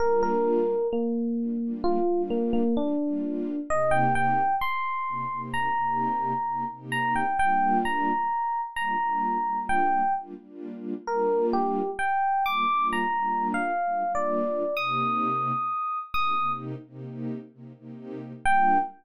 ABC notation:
X:1
M:4/4
L:1/16
Q:1/4=65
K:Gm
V:1 name="Electric Piano 1"
B B3 B,4 F2 B, B, D4 | e g g2 c'4 b6 b g | g2 b4 b4 g2 z4 | B2 G2 g2 d'2 (3b4 f4 d4 |
e'6 e'2 z8 | g4 z12 |]
V:2 name="String Ensemble 1"
[G,B,DF]6 [G,B,DF] [G,B,DF]2 [G,B,DF]3 [G,B,DF] [G,B,DF]3 | [C,B,EG]6 [C,B,EG] [C,B,EG]2 [C,B,EG]3 [C,B,EG] [C,B,EG]3 | [G,B,DF]6 [G,B,DF] [G,B,DF]2 [G,B,DF]3 [G,B,DF] [G,B,DF]3 | [G,B,DF]6 [G,B,DF] [G,B,DF]2 [G,B,DF]3 [G,B,DF] [G,B,DF]3 |
[C,B,EG]6 [C,B,EG] [C,B,EG]2 [C,B,EG]3 [C,B,EG] [C,B,EG]3 | [G,B,DF]4 z12 |]